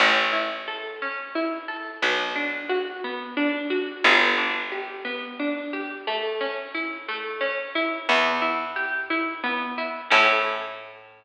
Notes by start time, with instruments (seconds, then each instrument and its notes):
0.00 electric bass (finger) A1, pizzicato strings C#4
0.33 pizzicato strings E4
0.68 pizzicato strings A4
1.02 pizzicato strings C#4
1.35 pizzicato strings E4
1.68 pizzicato strings A4
2.02 electric bass (finger) B1, pizzicato strings B3
2.36 pizzicato strings D4
2.69 pizzicato strings F#4
3.04 pizzicato strings B3
3.37 pizzicato strings D4
3.70 pizzicato strings F#4
4.04 electric bass (finger) G1, pizzicato strings B3
4.38 pizzicato strings D4
4.72 pizzicato strings G4
5.05 pizzicato strings B3
5.39 pizzicato strings D4
5.73 pizzicato strings G4
6.07 pizzicato strings A3
6.41 pizzicato strings C#4
6.74 pizzicato strings E4
7.08 pizzicato strings A3
7.41 pizzicato strings C#4
7.75 pizzicato strings E4
8.09 electric bass (finger) E2, pizzicato strings B3
8.42 pizzicato strings E4
8.76 pizzicato strings G4
9.10 pizzicato strings E4
9.44 pizzicato strings B3
9.78 pizzicato strings E4
10.10 electric bass (finger) A2, pizzicato strings C#4 E4
10.16 pizzicato strings A4